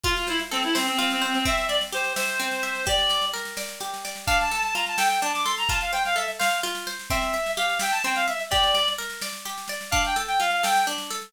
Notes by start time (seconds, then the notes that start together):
0.04 F4, kick, snare
0.16 F4, snare
0.27 E4 C5, snare
0.39 snare
0.51 C4 A4, snare
0.63 E4, snare
0.75 C4 C5, snare
0.87 C4, snare
0.99 C4 F4, snare
1.10 C4, snare
1.22 C4 C5, snare
1.34 C4, snare
1.45 C4 E5, kick, snare
1.58 snare
1.68 D5 E5, snare
1.81 snare
1.93 G4 C5, snare
2.04 snare
2.16 C5 E5, snare
2.27 snare
2.40 C4, snare
2.51 snare
2.63 E5, snare
2.75 snare
2.86 G4 D5, kick, snare
2.98 snare
3.09 D5, snare
3.22 snare
3.34 A#4, snare
3.45 snare
3.57 D5, snare
3.69 snare
3.80 G4, snare
3.94 snare
4.05 D5, snare
4.16 snare
4.27 D4 F5, kick, snare
4.40 A5, snare
4.51 A4 A5, snare
4.63 A5, snare
4.74 F4 A#5, snare
4.86 A5, snare
4.97 A4 G5, snare
5.09 G5, snare
5.21 D4 A5, snare
5.33 D6, snare
5.44 A4 C6, snare
5.57 A#5, snare
5.68 F4 A5, kick, snare
5.80 F5, snare
5.92 C5 G5, snare
6.05 F5, snare
6.16 A4 E5, snare
6.28 snare
6.39 C5 F5, snare
6.51 snare
6.63 F4, snare
6.75 snare
6.87 C5, snare
6.99 snare
7.10 C4 E5, kick, snare
7.22 snare
7.33 E5, snare
7.46 snare
7.57 G4 F5, snare
7.69 snare
7.79 E5 G5, snare
7.91 A5, snare
8.04 C4 G5, snare
8.15 F5, snare
8.28 E5, snare
8.39 snare
8.50 G4 D5, kick, snare
8.63 snare
8.74 D5, snare
8.88 snare
8.98 A#4, snare
9.10 snare
9.21 D5, snare
9.33 snare
9.45 G4, snare
9.58 snare
9.68 D5, snare
9.81 snare
9.91 D4 F5, kick, snare
10.05 G5, snare
10.16 A4, snare
10.28 G5, snare
10.40 F4 F5, snare
10.51 F5, snare
10.63 A4 G5, snare
10.76 snare
10.87 D4, snare
10.98 snare
11.10 A4, snare
11.22 snare